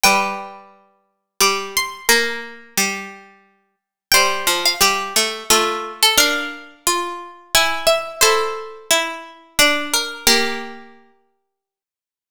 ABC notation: X:1
M:3/4
L:1/16
Q:1/4=88
K:F
V:1 name="Harpsichord"
g8 d'2 c'2 | b8 z4 | g3 f3 z2 A3 A | f8 ^g2 e2 |
c8 d2 B2 | G10 z2 |]
V:2 name="Harpsichord"
=B12 | B12 | c4 G4 F4 | B4 F4 E4 |
A4 E4 D4 | B8 z4 |]
V:3 name="Harpsichord"
G,8 G,4 | B,4 G,6 z2 | G,2 F,2 G,2 A,2 A,4 | D12 |
E12 | B,6 z6 |]